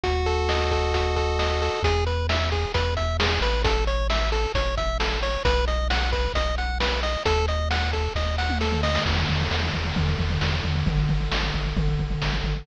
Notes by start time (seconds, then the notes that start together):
0.04 D#2 F#4, kick, closed hi-hat
0.26 A4, closed hi-hat
0.49 D#5, snare
0.71 A4, kick, closed hi-hat
0.94 F#4, kick, closed hi-hat
1.16 A4, kick, closed hi-hat
1.39 D#5, snare
1.62 A4, open hi-hat
1.83 E2 G#4, kick, closed hi-hat
2.07 B4, closed hi-hat
2.29 E5, snare
2.52 G#4, kick, closed hi-hat
2.74 E2 B4, kick, closed hi-hat
2.97 E5, kick, closed hi-hat
3.20 G#4, snare
3.41 A1 B4, closed hi-hat
3.64 A4, kick, closed hi-hat
3.87 C#5, closed hi-hat
4.10 E5, snare
4.32 A4, closed hi-hat
4.54 A1 C#5, kick, closed hi-hat
4.77 E5, kick, closed hi-hat
5.00 A4, snare
5.23 C#5, closed hi-hat
5.45 B1 B4, kick, closed hi-hat
5.68 D#5, closed hi-hat
5.90 F#5, snare
6.13 B4, kick, closed hi-hat
6.34 B1 D#5, kick, closed hi-hat
6.58 F#5, closed hi-hat
6.80 B4, snare
7.03 D#5, closed hi-hat
7.25 D#2 A4, kick, closed hi-hat
7.48 D#5, closed hi-hat
7.71 F#5, snare
7.93 A4, kick, closed hi-hat
8.15 D#2 D#5, kick, snare
8.38 F#5, snare
8.50 mid tom
8.61 A4, snare
8.72 floor tom
8.83 D#5, snare
8.95 snare
9.06 E2, kick, crash
9.17 floor tom
9.29 E2, floor tom
9.40 floor tom
9.51 E2, snare
9.63 floor tom
9.74 E2, kick, floor tom
9.85 floor tom
9.96 E2, kick, floor tom
10.07 floor tom
10.19 E2, kick, floor tom
10.30 floor tom
10.41 E2, snare
10.53 floor tom
10.64 E2, floor tom
10.75 floor tom
10.86 G#1, kick, floor tom
10.98 floor tom
11.09 G#1, floor tom
11.20 floor tom
11.32 G#1, snare
11.43 floor tom
11.54 G#1, kick, floor tom
11.65 floor tom
11.77 G#1, kick, floor tom
11.88 floor tom
11.98 G#1, kick, floor tom
12.10 floor tom
12.22 G#1, snare
12.33 floor tom
12.44 G#1, floor tom
12.56 floor tom